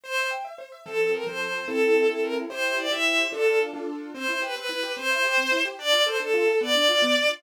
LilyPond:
<<
  \new Staff \with { instrumentName = "Violin" } { \time 6/8 \key c \major \tempo 4. = 146 c''4 r2 | \key f \major a'4 bes'8 c''4. | a'4. a'8 bes'8 r8 | c''4 d''8 e''4. |
a'4 r2 | \key c \major c''4 b'8 b'4. | c''2~ c''8 r8 | d''4 c''8 a'4. |
d''2~ d''8 r8 | }
  \new Staff \with { instrumentName = "Acoustic Grand Piano" } { \time 6/8 \key c \major c''8 e''8 g''8 e''8 c''8 e''8 | \key f \major <f c' a'>4. <f c' a'>4. | <c' e' a'>4. <c' e' a'>4. | <e' g' c''>4. <e' g' c''>4. |
<d' f' a'>4. <d' f' a'>4. | \key c \major c'8 e'8 g'8 c'8 e'8 g'8 | c'8 e'8 g'8 c'8 e'8 g'8 | d'8 f'8 a'8 d'8 f'8 a'8 |
b8 d'8 f'8 b8 d'8 f'8 | }
>>